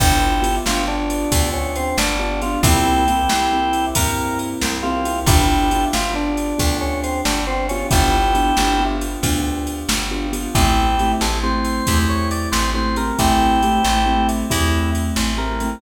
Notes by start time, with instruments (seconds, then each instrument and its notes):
0.00 electric bass (finger) G1, acoustic grand piano B3 D4 F4 G4, drawbar organ E4 G4, kick, crash
0.42 acoustic grand piano B3 D4 F4 G4, ride
0.66 electric bass (finger) G1, acoustic grand piano B3 D4 F4 G4, drawbar organ F4, snare
0.88 acoustic grand piano B3 D4 F4 G4, drawbar organ D4
1.10 ride
1.32 electric bass (finger) D2, acoustic grand piano B3 D4 F4 G4, kick, ride
1.53 drawbar organ C#4
1.76 drawbar organ C4, ride
1.98 electric bass (finger) G1, drawbar organ D4, snare
2.19 acoustic grand piano B3 D4 F4 G4, drawbar organ D4
2.42 acoustic grand piano B3 D4 F4 G4, drawbar organ F4, ride
2.63 electric bass (finger) C2, acoustic grand piano A#3 C4 E4 G4, drawbar organ E4 G4, kick, ride
3.08 acoustic grand piano A#3 C4 E4 G4, ride
3.29 electric bass (finger) C2, acoustic grand piano A#3 C4 E4 G4, snare
3.53 acoustic grand piano A#3 C4 E4 G4
3.73 ride
3.95 electric bass (finger) G2, acoustic grand piano A#3 C4 E4 G4, drawbar organ A#4, kick, ride
4.39 ride
4.61 electric bass (finger) C2, snare
4.83 acoustic grand piano A#3 C4 E4 G4, drawbar organ F4
5.05 acoustic grand piano A#3 C4 E4 G4, ride
5.26 electric bass (finger) G1, acoustic grand piano B3 D4 F4 G4, drawbar organ E4 G4, kick, ride
5.71 acoustic grand piano B3 D4 F4 G4, ride
5.93 electric bass (finger) G1, acoustic grand piano B3 D4 F4 G4, drawbar organ F4, snare
6.14 acoustic grand piano B3 D4 F4 G4, drawbar organ D4
6.37 ride
6.58 electric bass (finger) D2, acoustic grand piano B3 D4 F4 G4, kick, ride
6.81 drawbar organ C#4
7.03 drawbar organ C4, ride
7.25 electric bass (finger) G1, drawbar organ D4, snare
7.47 acoustic grand piano B3 D4 F4 G4, drawbar organ C4
7.69 acoustic grand piano B3 D4 F4 G4, drawbar organ C#4, ride
7.91 electric bass (finger) G1, acoustic grand piano B3 D4 F4 G4, drawbar organ E4 G4, kick, ride
8.35 acoustic grand piano B3 D4 F4 G4, ride
8.57 electric bass (finger) G1, acoustic grand piano B3 D4 F4 G4, snare
8.80 acoustic grand piano B3 D4 F4 G4
9.01 ride
9.23 electric bass (finger) D2, acoustic grand piano B3 D4 F4 G4, kick, ride
9.67 ride
9.89 electric bass (finger) G1, snare
10.11 acoustic grand piano B3 D4 F4 G4
10.33 acoustic grand piano B3 D4 F4 G4, ride
10.55 electric bass (finger) A1, acoustic grand piano A3 C4 E4 G4, drawbar organ E4 G4, kick, ride
10.99 acoustic grand piano A3 C4 E4 G4, ride
11.21 electric bass (finger) A1, acoustic grand piano A3 C4 E4 G4, drawbar organ A4, snare
11.43 acoustic grand piano A3 C4 E4 G4, drawbar organ C5
11.65 ride
11.87 electric bass (finger) E2, acoustic grand piano A3 C4 E4 G4, kick, ride
12.09 drawbar organ C#5
12.31 drawbar organ D5, ride
12.52 electric bass (finger) A1, drawbar organ C5, snare
12.74 acoustic grand piano A3 C4 E4 G4, drawbar organ C5
12.96 acoustic grand piano A3 C4 E4 G4, drawbar organ A#4, ride
13.19 electric bass (finger) A1, acoustic grand piano A3 C4 E4 G4, drawbar organ E4 G4, kick, ride
13.63 acoustic grand piano A3 C4 E4 G4, ride
13.83 electric bass (finger) A1, acoustic grand piano A3 C4 E4 G4, snare
14.06 acoustic grand piano A3 C4 E4 G4
14.29 ride
14.50 electric bass (finger) E2, acoustic grand piano A3 C4 E4 G4, drawbar organ E4, kick, ride
14.95 ride
15.16 electric bass (finger) A1, snare
15.38 acoustic grand piano A3 C4 E4 G4, drawbar organ A#4
15.60 acoustic grand piano A3 C4 E4 G4, ride